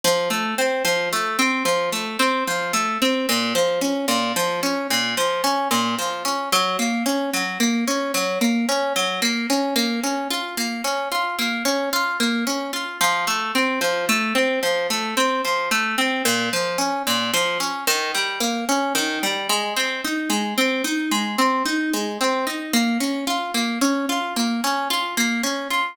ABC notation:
X:1
M:3/4
L:1/8
Q:1/4=111
K:Bbm
V:1 name="Orchestral Harp"
F, =A, C F, A, C | F, =A, C F, A, C | B,, F, D B,, F, D | B,, F, D B,, F, D |
G, B, D G, B, D | G, B, D G, B, D | B, D F B, D F | B, D F B, D F |
F, =A, C F, A, C | F, =A, C F, A, C | B,, F, D B,, F, D | E, =G, B, D E, G, |
A, C E A, C E | A, C E A, C E | B, D F B, D F | B, D F B, D F |]